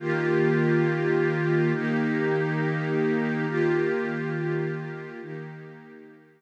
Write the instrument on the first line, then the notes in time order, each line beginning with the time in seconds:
pad 2 (warm)
0.00 D#3 A#3 F4 G4
1.74 D#3 A#3 D#4 G4
3.48 D#3 A#3 F4 G4
5.22 D#3 A#3 D#4 G4